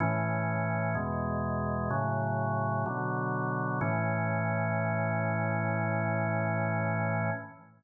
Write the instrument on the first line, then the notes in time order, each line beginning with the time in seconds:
drawbar organ
0.00 A2 E3 C#4
0.95 E2 B2 G#3
1.90 A2 C#3 F#3
2.86 B2 D3 F#3
3.81 A2 E3 C#4